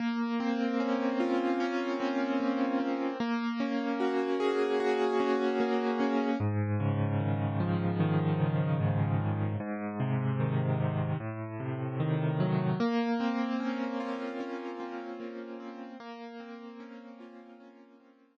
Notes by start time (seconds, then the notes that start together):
0.00 A#3
0.40 C4
0.80 C#4
1.20 F4
1.60 C#4
2.00 C4
2.40 A#3
2.80 C4
3.20 A#3
3.60 C#4
4.00 F#4
4.40 G#4
4.80 F#4
5.20 C#4
5.60 A#3
6.00 C#4
6.40 G#2
6.80 C#3
7.20 D#3
7.60 F3
8.00 D#3
8.40 C#3
8.80 G#2
9.20 C#3
9.60 G#2
10.00 C3
10.40 D#3
10.80 C3
11.20 A2
11.60 C3
12.00 D#3
12.40 F#3
12.80 A#3
13.20 C4
13.60 C#4
14.00 F4
14.40 C#4
14.80 C4
15.20 A#3
15.60 C4
16.00 A#3
16.40 C4
16.80 C#4
17.20 F4
17.60 C#4
18.00 C4